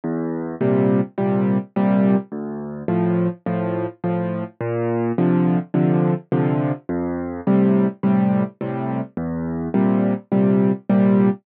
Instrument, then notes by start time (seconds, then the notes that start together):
acoustic grand piano
0.04 E2
0.61 A#2 C3 G3
1.18 A#2 C3 G3
1.76 A#2 C3 G3
2.32 D2
2.88 A2 F3
3.46 A2 F3
4.04 A2 F3
4.61 A#2
5.18 C3 D3 F3
5.74 C3 D3 F3
6.32 C3 D3 F3
6.89 F2
7.47 A2 C3 G3
8.03 A2 C3 G3
8.61 A2 C3 G3
9.17 E2
9.74 A#2 C3 G3
10.32 A#2 C3 G3
10.89 A#2 C3 G3